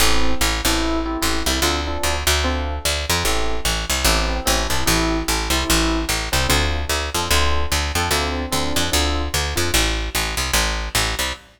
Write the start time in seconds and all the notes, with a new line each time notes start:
0.00 A1 C4 E4 G4 A4
0.41 A1
0.65 A1 C4 E4 G4 A4
1.05 C4 E4 G4 A4
1.22 A1 C4 E4 G4 A4
1.46 C2 C4 E4 G4 A4
1.62 D2 C4 D4 F4 A4
1.87 C4 D4 F4 A4
2.03 D2
2.27 D2
2.44 C4 D4 F4 A4
2.85 D2
3.10 F2
3.24 A1 C4 E4 G4 A4
3.65 A1
3.90 C2
4.04 A1 C4 E4 G4 A4
4.45 A1 C4 E4 G4 A4
4.70 C2 C4 E4 G4 A4
4.86 A1 C4 E4 G4 A4
5.28 A1
5.50 C2 C4 E4 G4 A4
5.70 A1
6.09 A1
6.32 C2 C4 E4 G4 A4
6.49 D2 C4 D4 F4 A4
6.89 D2
7.14 F2 C4 D4 F4 A4
7.31 D2 C4 D4 F4 A4
7.72 D2
7.95 F2 C4 D4 F4 A4
8.11 D2 C4 D4 F4 A4
8.52 D2 C4 D4 F4 A4
8.76 F2
8.92 D2 C4 D4 F4 A4
9.34 D2
9.55 F2 C4 D4 F4 A4
9.74 A1
10.15 A1
10.37 C2
10.53 A1
10.95 A1
11.19 C2